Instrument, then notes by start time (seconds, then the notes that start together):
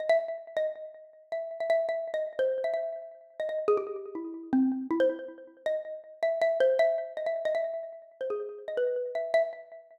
xylophone
0.00 D#5
0.09 E5
0.57 D#5
1.32 E5
1.60 E5
1.70 E5
1.89 E5
2.14 D#5
2.39 C5
2.64 E5
2.74 E5
3.40 D#5
3.49 D#5
3.68 G#4
3.77 G4
4.15 E4
4.53 C4
4.91 E4
5.00 C5
5.66 D#5
6.23 E5
6.42 E5
6.60 C5
6.79 E5
7.17 D#5
7.26 E5
7.45 D#5
7.55 E5
8.21 C5
8.30 G#4
8.68 D#5
8.77 B4
9.15 E5
9.34 E5